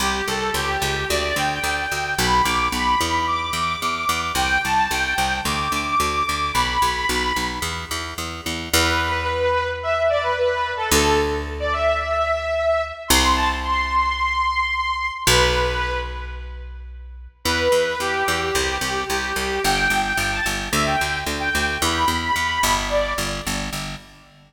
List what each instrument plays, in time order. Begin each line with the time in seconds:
0.00 electric bass (finger) C2, lead 2 (sawtooth) G4
0.28 electric bass (finger) C2, lead 2 (sawtooth) A4
0.54 electric bass (finger) C#2, lead 2 (sawtooth) G4
0.82 electric bass (finger) C#2
1.09 electric bass (finger) D2, lead 2 (sawtooth) D5
1.36 electric bass (finger) D2, lead 2 (sawtooth) G5
1.64 electric bass (finger) D2
1.92 electric bass (finger) D2
2.19 electric bass (finger) B1, lead 2 (sawtooth) B5
2.44 electric bass (finger) B1, lead 2 (sawtooth) D6
2.72 electric bass (finger) B1, lead 2 (sawtooth) B5
3.01 electric bass (finger) E2
3.26 lead 2 (sawtooth) D6
3.53 electric bass (finger) E2, lead 2 (sawtooth) D6
3.82 electric bass (finger) E2
4.09 electric bass (finger) E2
4.35 electric bass (finger) C2, lead 2 (sawtooth) G5
4.64 electric bass (finger) C2, lead 2 (sawtooth) A5
4.91 electric bass (finger) C2, lead 2 (sawtooth) G5
5.18 electric bass (finger) C2
5.45 electric bass (finger) D2, lead 2 (sawtooth) D6
5.72 electric bass (finger) D2, lead 2 (sawtooth) D6
6.00 electric bass (finger) D2
6.29 electric bass (finger) D2
6.54 electric bass (finger) B1, lead 2 (sawtooth) B5
6.82 electric bass (finger) B1
7.09 electric bass (finger) B1
7.36 electric bass (finger) B1
7.62 electric bass (finger) E2
7.91 electric bass (finger) E2
8.18 electric bass (finger) E2
8.46 electric bass (finger) E2
8.73 electric bass (finger) E2, lead 2 (sawtooth) B4
9.83 lead 2 (sawtooth) E5
10.09 lead 2 (sawtooth) D5
10.23 lead 2 (sawtooth) B4
10.37 lead 2 (sawtooth) B4
10.77 lead 2 (sawtooth) A4
10.91 electric bass (finger) D2, lead 2 (sawtooth) A4
11.60 lead 2 (sawtooth) D5
11.73 lead 2 (sawtooth) E5
13.08 electric bass (finger) C2, lead 2 (sawtooth) C6
13.36 lead 2 (sawtooth) A5
13.65 lead 2 (sawtooth) C6
14.17 lead 2 (sawtooth) C6
15.27 electric bass (finger) B1, lead 2 (sawtooth) B4
17.45 electric bass (finger) E2, lead 2 (sawtooth) B4
17.72 electric bass (finger) E2
17.99 electric bass (finger) E2, lead 2 (sawtooth) G4
18.28 electric bass (finger) E2
18.55 electric bass (finger) C2
18.81 electric bass (finger) C2
19.09 electric bass (finger) C2, lead 2 (sawtooth) G4
19.36 electric bass (finger) C2
19.64 electric bass (finger) G1, lead 2 (sawtooth) G5
19.90 electric bass (finger) G1
20.03 lead 2 (sawtooth) G5
20.16 electric bass (finger) G1, lead 2 (sawtooth) G5
20.33 lead 2 (sawtooth) A5
20.46 electric bass (finger) G1
20.73 electric bass (finger) D2, lead 2 (sawtooth) E5
20.86 lead 2 (sawtooth) G5
21.01 electric bass (finger) D2
21.26 electric bass (finger) D2
21.40 lead 2 (sawtooth) G5
21.55 electric bass (finger) D2
21.82 electric bass (finger) E2, lead 2 (sawtooth) B5
22.08 electric bass (finger) E2
22.36 electric bass (finger) E2
22.63 electric bass (finger) G1
22.90 lead 2 (sawtooth) D5
23.18 electric bass (finger) G1
23.47 electric bass (finger) G1
23.73 electric bass (finger) G1